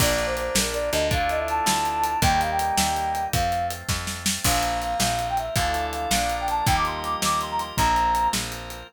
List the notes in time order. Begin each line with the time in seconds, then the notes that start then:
0.00 A#1 A#3 D4 F4 D5, kick, crash
0.19 closed hi-hat
0.26 C5
0.37 C5, closed hi-hat
0.55 A#1 A#4, snare
0.74 D5, closed hi-hat
0.92 D2 D#5, closed hi-hat
1.11 A3 D4 E4 F4 F5, kick, closed hi-hat
1.29 D#5, closed hi-hat
1.39 E5
1.48 A5, closed hi-hat
1.66 D2, snare
1.85 closed hi-hat
2.04 closed hi-hat
2.22 D#2 G3 A#3 D#4 G5, kick, closed hi-hat
2.40 F5, closed hi-hat
2.51 G5
2.59 G5, closed hi-hat
2.78 D#2, snare
2.96 closed hi-hat
3.15 closed hi-hat
3.33 F2 F3 A3 C4 F5, kick, closed hi-hat
3.52 closed hi-hat
3.71 closed hi-hat
3.89 F2, kick, snare
4.07 snare
4.26 snare
4.44 A#1 F3 A#3 C4 F4 A#4 C5 F5, kick, crash
4.63 closed hi-hat
4.81 F5, closed hi-hat
5.00 A#1 F5, snare
5.19 closed hi-hat
5.29 G5
5.37 E5, closed hi-hat
5.55 D2 E3 F3 A3 D4 E4 F4 A4 D5 F5, kick, closed hi-hat
5.74 closed hi-hat
5.92 F5, closed hi-hat
6.10 A#1 F3 A#3 D4 F4 A#4 D5 F5, snare
6.30 closed hi-hat
6.40 G5
6.48 A5, closed hi-hat
6.66 D#2 F3 G3 A#3 D#4 F4 G4 A#4 D#5 G5, kick, closed hi-hat
6.76 D6
6.85 C6, closed hi-hat
6.96 C6
7.04 D6, closed hi-hat
7.22 D#2 D6, snare
7.41 C6, closed hi-hat
7.50 A#5
7.59 C6, closed hi-hat
7.77 A#1 F3 A#3 C4 F4 A#4 C5 A#5, kick, closed hi-hat
7.96 closed hi-hat
8.15 closed hi-hat
8.33 A#1, snare
8.52 closed hi-hat
8.70 closed hi-hat